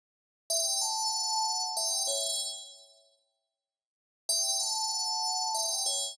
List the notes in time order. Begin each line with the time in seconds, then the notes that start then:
0.50 E5 G5
0.81 F#5 A5
1.77 E5 G5
2.07 C#5 E5
4.29 E5 G5
4.60 F#5 A5
5.54 E5 G5
5.86 C#5 E5